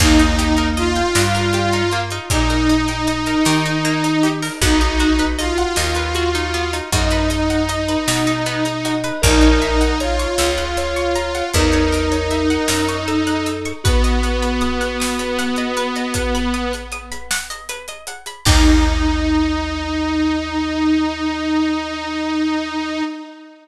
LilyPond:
<<
  \new Staff \with { instrumentName = "Lead 2 (sawtooth)" } { \time 12/8 \key ees \mixolydian \tempo 4. = 52 ees'4 f'2 ees'2. | ees'4 f'2 ees'2. | ees'4 f'2 ees'2. | ces'1~ ces'8 r4. |
ees'1. | }
  \new Staff \with { instrumentName = "Electric Piano 2" } { \time 12/8 \key ees \mixolydian bes4. g4 r2. r8 | ges'2 ges'4 ees''2~ ees''8 ees''8 | bes'4 des''4 des''4 bes'2 a'4 | ges'2.~ ges'8 r2 r8 |
ees'1. | }
  \new Staff \with { instrumentName = "Pizzicato Strings" } { \time 12/8 \key ees \mixolydian bes16 ees'16 g'16 bes'16 ees''16 g''16 ees''16 bes'16 g'16 ees'16 bes16 ees'16 g'16 bes'16 ees''16 g''16 ees''16 bes'16 g'16 ees'16 bes16 ees'16 g'16 bes'16 | ces'16 ees'16 ges'16 ces''16 ees''16 ges''16 ees''16 ces''16 ges'16 ees'16 ces'16 ees'16 ges'16 ces''16 ees''16 ges''16 ees''16 ces''16 ges'16 ees'16 ces'16 ees'16 ges'16 ces''16 | bes'16 des''16 fes''16 ges''16 bes''16 des'''16 fes'''16 ges'''16 fes'''16 des'''16 bes''16 ges''16 fes''16 des''16 bes'16 des''16 fes''16 ges''16 bes''16 des'''16 fes'''16 ges'''16 fes'''16 des'''16 | ces''16 ees''16 ges''16 ces'''16 ees'''16 ges'''16 ees'''16 ces'''16 ges''16 ees''16 ces''16 ees''16 ges''16 ces'''16 ees'''16 ges'''16 ees'''16 ces'''16 ges''16 ees''16 ces''16 ees''16 ges''16 ces'''16 |
<bes ees' g'>1. | }
  \new Staff \with { instrumentName = "Electric Bass (finger)" } { \clef bass \time 12/8 \key ees \mixolydian ees,4. g,4. bes,4. ees4. | ces,4. ees,4. ges,4. ces4. | bes,,4. des,4. fes,4. ges,4. | r1. |
ees,1. | }
  \new DrumStaff \with { instrumentName = "Drums" } \drummode { \time 12/8 <cymc bd>16 hh16 hh16 hh16 hh16 hh16 sn16 hh16 hh16 hh16 hh16 hh16 <hh bd>16 hh16 hh16 hh16 hh16 hh16 sn16 hh16 hh16 hh16 hh16 hho16 | <hh bd>16 hh16 hh16 hh16 hh16 hh16 sn16 hh16 hh16 hh16 hh16 hh16 <hh bd>16 hh16 hh16 hh16 hh16 hh16 sn16 hh16 hh16 hh16 hh16 hh16 | <hh bd>16 hh16 hh16 hh16 hh16 hh16 sn16 hh16 hh16 hh16 hh16 hh16 <hh bd>16 hh16 hh16 hh16 hh16 hh16 sn16 hh16 hh16 hh16 hh16 hh16 | <hh bd>16 hh16 hh16 hh16 hh16 hh16 sn16 hh16 hh16 hh16 hh16 hh16 <hh bd>16 hh16 hh16 hh16 hh16 hh16 sn16 hh16 hh16 hh16 hh16 hh16 |
<cymc bd>4. r4. r4. r4. | }
>>